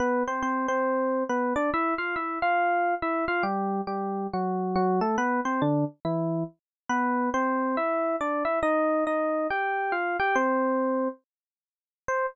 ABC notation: X:1
M:4/4
L:1/8
Q:"Swing" 1/4=139
K:C
V:1 name="Electric Piano 1"
[B,B] [Cc] [Cc] [Cc]3 [B,B] [Dd] | [Ee] [Ff] [Ee] [Ff]3 [Ee] [Ff] | [G,G]2 [G,G]2 [^F,^F]2 [F,F] [A,A] | [B,B] [Cc] [D,D] z [E,E]2 z2 |
[B,B]2 [Cc]2 [Ee]2 [Dd] [Ee] | [_E_e]2 [Ee]2 [Gg]2 [Ff] [Gg] | [Cc]4 z4 | c2 z6 |]